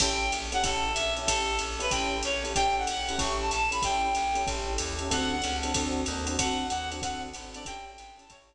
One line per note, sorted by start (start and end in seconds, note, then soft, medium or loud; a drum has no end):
0.00 0.31 A1 loud
0.00 0.25 C#4 medium
0.00 0.25 E4 medium
0.00 0.25 G4 medium
0.00 0.25 A4 loud
0.00 0.32 G5 loud
0.00 kick medium
0.00 crash medium
0.00 ride medium
0.32 0.63 A#1 medium
0.32 hi-hat pedal medium
0.32 ride medium
0.52 0.60 C#4 medium
0.52 0.60 E4 medium
0.52 0.60 G4 medium
0.52 0.60 A4 medium
0.52 0.63 F#5 loud
0.52 ride medium
0.63 0.94 A1 medium
0.63 0.88 C#4 loud
0.63 0.88 E4 medium
0.63 0.88 G4 loud
0.63 0.88 A4 loud
0.63 0.92 A4 loud
0.63 kick medium
0.63 ride medium
0.94 1.26 A#1 medium
0.94 1.14 E5 loud
0.94 hi-hat pedal medium
0.94 ride medium
1.16 1.25 C#4 medium
1.16 1.25 E4 medium
1.16 1.25 G4 medium
1.16 1.25 A4 medium
1.16 ride medium
1.26 1.59 A1 medium
1.26 1.52 C#4 medium
1.26 1.52 E4 medium
1.26 1.52 G4 loud
1.26 1.57 A4 loud
1.26 1.52 A4 medium
1.26 kick medium
1.26 ride loud
1.59 1.90 A#1 medium
1.59 hi-hat pedal medium
1.59 ride medium
1.79 1.87 C#4 medium
1.79 1.87 E4 medium
1.79 1.87 G4 medium
1.79 1.87 A4 medium
1.79 1.92 B4 loud
1.79 ride medium
1.90 2.22 A1 medium
1.90 2.17 C#4 loud
1.90 2.17 E4 medium
1.90 2.17 G4 medium
1.90 2.17 A4 loud
1.90 2.18 G5 loud
1.90 kick medium
1.90 ride medium
2.23 2.54 A#1 medium
2.23 2.43 C#5 loud
2.23 hi-hat pedal medium
2.23 ride medium
2.44 2.52 C#4 medium
2.44 2.52 E4 medium
2.44 2.52 G4 medium
2.44 2.52 A4 medium
2.44 ride medium
2.55 2.86 A1 medium
2.55 2.81 C#4 loud
2.55 2.81 E4 medium
2.55 2.81 G4 loud
2.55 2.81 A4 medium
2.55 2.75 G5 loud
2.55 kick soft
2.55 ride medium
2.78 3.20 F#5 loud
2.87 3.18 A#1 medium
2.87 hi-hat pedal medium
2.87 ride medium
3.09 3.17 C#4 medium
3.09 3.17 E4 medium
3.09 3.17 G4 medium
3.09 3.17 A4 medium
3.09 ride medium
3.18 3.50 A1 loud
3.18 3.43 C#4 loud
3.18 3.43 E4 medium
3.18 3.43 G4 medium
3.18 3.43 A4 medium
3.18 3.37 C#6 medium
3.18 kick medium
3.18 ride medium
3.41 3.50 A5 loud
3.51 3.82 A#1 medium
3.51 3.69 A5 loud
3.51 hi-hat pedal medium
3.51 ride medium
3.71 3.79 C#4 medium
3.71 3.79 E4 medium
3.71 3.79 G4 medium
3.71 3.79 A4 medium
3.71 3.82 B5 loud
3.71 ride medium
3.82 4.14 A1 medium
3.82 4.08 C#4 medium
3.82 4.08 E4 medium
3.82 4.08 G4 medium
3.82 4.08 A4 medium
3.82 4.42 G5 loud
3.82 kick medium
3.82 ride medium
4.15 4.46 A#1 medium
4.15 hi-hat pedal medium
4.15 ride medium
4.35 4.43 C#4 medium
4.35 4.43 E4 medium
4.35 4.43 G4 medium
4.35 4.43 A4 medium
4.35 ride medium
4.46 4.78 A1 medium
4.46 4.71 C#4 loud
4.46 4.71 E4 loud
4.46 4.71 G4 medium
4.46 4.71 A4 loud
4.46 kick medium
4.46 ride medium
4.78 5.09 D#2 medium
4.78 hi-hat pedal medium
4.78 ride medium
4.99 5.07 C#4 medium
4.99 5.07 E4 medium
4.99 5.07 G4 medium
4.99 5.07 A4 medium
4.99 ride medium
5.10 5.41 D2 medium
5.10 5.35 C4 medium
5.10 5.35 D4 medium
5.10 5.35 F#4 medium
5.10 5.35 A4 loud
5.10 5.30 F#5 loud
5.10 kick soft
5.10 ride medium
5.31 5.56 F#5 loud
5.42 5.74 C#2 medium
5.42 hi-hat pedal medium
5.42 ride medium
5.63 5.71 C4 medium
5.63 5.71 D4 medium
5.63 5.71 F#4 medium
5.63 5.71 A4 medium
5.63 ride medium
5.74 6.06 D2 medium
5.74 6.01 C4 loud
5.74 6.01 D4 loud
5.74 6.01 F#4 medium
5.74 6.01 A4 medium
5.74 kick medium
5.74 ride medium
6.06 6.37 D#2 medium
6.06 hi-hat pedal medium
6.06 ride medium
6.27 6.35 C4 medium
6.27 6.35 D4 medium
6.27 6.35 F#4 medium
6.27 6.35 A4 medium
6.27 ride medium
6.38 6.69 D2 medium
6.38 6.64 C4 medium
6.38 6.64 D4 medium
6.38 6.64 F#4 loud
6.38 6.64 A4 medium
6.38 6.67 F#5 loud
6.38 kick medium
6.38 ride medium
6.69 7.01 D#2 medium
6.69 6.89 F#5 loud
6.69 hi-hat pedal medium
6.69 ride medium
6.91 6.99 C4 medium
6.91 6.99 D4 medium
6.91 6.99 F#4 medium
6.91 6.99 A4 medium
6.91 ride medium
7.02 7.33 D2 medium
7.02 7.27 C4 medium
7.02 7.27 D4 medium
7.02 7.27 F#4 loud
7.02 7.27 A4 medium
7.02 7.22 F#5 loud
7.02 kick medium
7.02 ride medium
7.34 7.65 G#1 medium
7.34 hi-hat pedal medium
7.34 ride medium
7.54 7.63 C4 medium
7.54 7.63 D4 medium
7.54 7.63 F#4 medium
7.54 7.63 A4 medium
7.54 7.65 D5 loud
7.54 ride medium
7.65 7.97 A1 medium
7.65 7.91 C#4 loud
7.65 7.91 E4 loud
7.65 7.91 G4 medium
7.65 7.91 A4 loud
7.65 7.85 G5 loud
7.65 kick medium
7.65 ride medium
7.85 8.10 G5 loud
7.98 8.29 G#1 medium
7.98 hi-hat pedal medium
7.98 ride medium
8.17 8.25 C#4 medium
8.17 8.25 E4 medium
8.17 8.25 G4 medium
8.17 8.25 A4 medium
8.17 8.30 A5 medium
8.17 ride medium
8.30 8.55 A1 medium
8.30 8.55 C#4 medium
8.30 8.55 E4 loud
8.30 8.55 G4 medium
8.30 8.55 A4 medium
8.30 8.55 C#5 medium
8.30 kick medium
8.30 ride medium